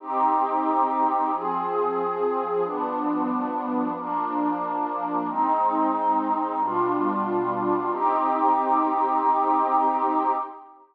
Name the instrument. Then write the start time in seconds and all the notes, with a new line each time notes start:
pad 2 (warm)
0.00 C4 D#4 G4
1.32 F3 C4 G#4
2.63 G2 F3 B3 D4
3.96 F3 A#3 D4
5.27 G#3 C4 D#4
6.59 B2 G3 D4 F4
7.90 C4 D#4 G4